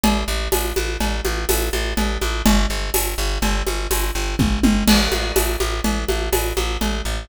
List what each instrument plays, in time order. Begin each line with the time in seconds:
0.04 electric bass (finger) A1, cowbell, low conga
0.28 electric bass (finger) A1
0.52 electric bass (finger) A1, tambourine, cowbell, high conga
0.76 electric bass (finger) A1, high conga
1.01 electric bass (finger) A1, cowbell, low conga
1.25 electric bass (finger) A1, high conga
1.49 electric bass (finger) A1, tambourine, cowbell, high conga
1.73 electric bass (finger) A1, high conga
1.97 electric bass (finger) A1, cowbell, low conga
2.21 electric bass (finger) A1, high conga
2.46 electric bass (finger) G1, cowbell, low conga
2.70 electric bass (finger) G1
2.94 electric bass (finger) G1, tambourine, cowbell, high conga
3.18 electric bass (finger) G1
3.42 electric bass (finger) G1, cowbell, low conga
3.67 electric bass (finger) G1, high conga
3.91 electric bass (finger) G1, tambourine, cowbell, high conga
4.15 electric bass (finger) G1
4.39 electric bass (finger) G1, kick, high tom
4.63 electric bass (finger) G1, high tom
4.88 electric bass (finger) A1, crash, cowbell, low conga
5.12 electric bass (finger) A1, high conga
5.36 electric bass (finger) A1, tambourine, cowbell, high conga
5.60 electric bass (finger) A1, high conga
5.84 electric bass (finger) A1, cowbell, low conga
6.09 electric bass (finger) A1, high conga
6.33 electric bass (finger) A1, tambourine, cowbell, high conga
6.57 electric bass (finger) A1, high conga
6.81 electric bass (finger) A1, cowbell, low conga
7.05 electric bass (finger) A1